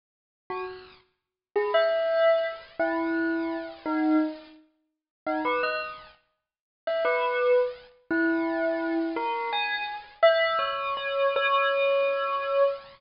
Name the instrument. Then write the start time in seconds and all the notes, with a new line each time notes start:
tubular bells
0.50 F#4
1.56 G#4
1.74 E5
2.79 E4
3.86 D#4
5.26 D#4
5.45 B4
5.63 D#5
6.87 E5
7.05 B4
8.11 E4
9.16 A#4
9.53 G#5
10.23 E5
10.59 C#5
10.97 C#5
11.36 C#5